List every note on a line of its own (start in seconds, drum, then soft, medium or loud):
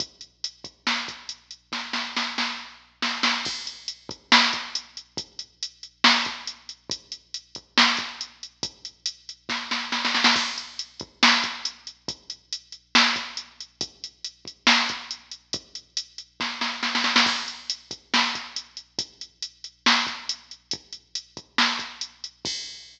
0.00 kick loud
0.00 closed hi-hat loud
0.21 closed hi-hat medium
0.44 closed hi-hat loud
0.64 kick medium
0.64 closed hi-hat medium
0.87 snare medium
1.08 kick medium
1.08 closed hi-hat medium
1.29 closed hi-hat medium
1.51 closed hi-hat medium
1.72 kick medium
1.72 snare medium
1.93 snare medium
2.16 snare medium
2.38 snare medium
3.02 snare medium
3.23 snare loud
3.45 kick loud
3.45 crash loud
3.67 closed hi-hat medium
3.88 closed hi-hat medium
4.09 kick loud
4.09 closed hi-hat medium
4.32 snare loud
4.53 kick medium
4.53 closed hi-hat medium
4.75 closed hi-hat loud
4.97 closed hi-hat medium
5.17 kick loud
5.17 closed hi-hat loud
5.39 closed hi-hat medium
5.63 closed hi-hat loud
5.83 closed hi-hat medium
6.04 snare loud
6.25 kick medium
6.25 closed hi-hat medium
6.47 closed hi-hat medium
6.69 closed hi-hat medium
6.90 kick loud
6.90 closed hi-hat loud
7.12 closed hi-hat medium
7.34 closed hi-hat medium
7.55 kick medium
7.55 closed hi-hat medium
7.78 snare loud
7.97 kick medium
7.97 closed hi-hat medium
8.21 closed hi-hat medium
8.43 closed hi-hat medium
8.63 kick loud
8.63 closed hi-hat loud
8.85 closed hi-hat medium
9.06 closed hi-hat loud
9.29 closed hi-hat medium
9.49 kick medium
9.49 snare medium
9.71 snare medium
9.92 snare medium
10.05 snare medium
10.15 snare medium
10.24 snare loud
10.36 kick loud
10.36 crash loud
10.58 closed hi-hat medium
10.79 closed hi-hat medium
11.00 kick loud
11.00 closed hi-hat medium
11.23 snare loud
11.44 kick medium
11.44 closed hi-hat medium
11.65 closed hi-hat loud
11.87 closed hi-hat medium
12.08 kick loud
12.08 closed hi-hat loud
12.30 closed hi-hat medium
12.53 closed hi-hat loud
12.72 closed hi-hat medium
12.95 snare loud
13.16 kick medium
13.16 closed hi-hat medium
13.37 closed hi-hat medium
13.60 closed hi-hat medium
13.81 kick loud
13.81 closed hi-hat loud
14.04 closed hi-hat medium
14.24 closed hi-hat medium
14.45 kick medium
14.45 closed hi-hat medium
14.67 snare loud
14.89 kick medium
14.89 closed hi-hat medium
15.11 closed hi-hat medium
15.31 closed hi-hat medium
15.53 kick loud
15.53 closed hi-hat loud
15.75 closed hi-hat medium
15.97 closed hi-hat loud
16.18 closed hi-hat medium
16.40 kick medium
16.40 snare medium
16.61 snare medium
16.83 snare medium
16.95 snare medium
17.04 snare medium
17.16 snare loud
17.26 kick medium
17.26 crash loud
17.48 closed hi-hat medium
17.70 closed hi-hat loud
17.91 kick medium
17.91 closed hi-hat medium
18.14 snare loud
18.35 kick medium
18.35 closed hi-hat medium
18.56 closed hi-hat loud
18.77 closed hi-hat medium
18.99 kick loud
18.99 closed hi-hat loud
19.21 closed hi-hat medium
19.42 closed hi-hat loud
19.64 closed hi-hat medium
19.86 snare loud
20.07 kick medium
20.07 closed hi-hat medium
20.29 closed hi-hat loud
20.51 closed hi-hat medium
20.71 kick loud
20.71 closed hi-hat loud
20.93 closed hi-hat medium
21.15 closed hi-hat loud
21.37 kick medium
21.37 closed hi-hat medium
21.58 snare loud
21.79 kick medium
21.79 closed hi-hat medium
22.01 closed hi-hat loud
22.24 closed hi-hat medium
22.45 kick loud
22.45 crash loud